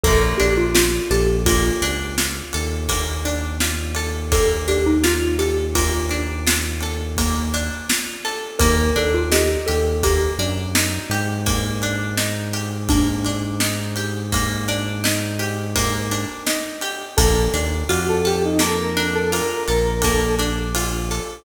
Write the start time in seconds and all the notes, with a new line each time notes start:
0.04 A#1 A#3 A4, kick, crash
0.38 A#1 D4 G4, ride
0.57 F4
0.75 F4, snare
1.10 A#1 G4 A4, ride
1.46 A#3 F4, kick, ride
1.82 C#2 D4, ride
2.18 F4, snare
2.53 D#2 A4, ride
2.88 A#3, kick, ride
3.25 D4, ride
3.60 F4, snare
3.95 A4, ride
4.32 A#3 A4, kick, ride
4.68 D4 G4, ride
4.86 D#4
5.04 F4, snare
5.39 G4 A4, ride
5.75 A#3 F4, kick, ride
6.09 D4, ride
6.47 F4, snare
6.81 A4, ride
7.17 A#3, kick, ride
7.54 D4, ride
7.89 F4, snare
8.25 A4, ride
8.59 D#2 A#3 A#4, kick, ride
8.96 D#2 D4 A4, ride
9.14 F4
9.32 D#4 G4, snare
9.67 D#2 G4 A4, ride
10.03 A#3 G4, kick, ride
10.38 F#2 D4, ride
10.75 D#4, snare
11.10 G#2 G4, ride
11.46 A#3, kick, ride
11.82 D4, ride
12.17 D#4, snare
12.53 G4, ride
12.89 A#3 D4, kick, ride
13.25 D4, ride
13.60 D#4, snare
13.96 G4, ride
14.32 A#3, kick, ride
14.68 D4, ride
15.04 D#4, snare
15.39 G4, ride
15.76 A#3, kick, ride
16.11 D4, ride
16.47 D#4, snare
16.81 G4, ride
17.17 A#1 A#3 A4, kick, ride
17.54 D#2 D4, ride
17.89 F2 F4 F#4, ride
18.08 A4
18.25 G4 A4, ride
18.45 D#4
18.59 A#3 A4, snare
18.77 A#4
18.97 D4, ride
19.14 A4
19.32 F4 A#4, ride
19.68 A#1 A4 A#4, ride
20.02 A#3 A4, kick, ride
20.39 D4, ride
20.75 F4, ride
21.11 A4, ride